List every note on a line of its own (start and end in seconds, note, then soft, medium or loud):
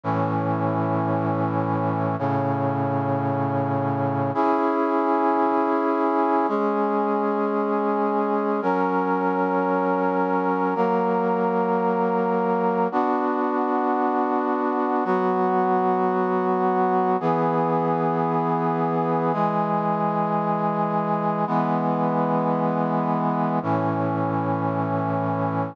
0.04 2.16 A2 medium
0.04 2.16 E3 medium
0.04 2.16 C#4 medium
2.19 4.31 A2 medium
2.19 4.31 C#3 medium
2.19 4.31 C#4 medium
4.34 6.46 C#4 medium
4.34 6.46 E4 medium
4.34 6.46 G#4 medium
6.48 8.60 G#3 medium
6.48 8.60 C#4 medium
6.48 8.60 G#4 medium
8.62 10.74 F#3 medium
8.62 10.74 C#4 medium
8.62 10.74 A#4 medium
10.75 12.88 F#3 medium
10.75 12.88 A#3 medium
10.75 12.88 A#4 medium
12.92 15.04 B3 medium
12.92 15.04 D4 medium
12.92 15.04 F#4 medium
15.04 17.17 F#3 medium
15.04 17.17 B3 medium
15.04 17.17 F#4 medium
17.20 19.32 E3 medium
17.20 19.32 B3 medium
17.20 19.32 G#4 medium
19.33 21.45 E3 medium
19.33 21.45 G#3 medium
19.33 21.45 G#4 medium
21.47 23.59 E3 medium
21.47 23.59 G#3 medium
21.47 23.59 B3 medium
23.63 25.75 A2 medium
23.63 25.75 E3 medium
23.63 25.75 C#4 medium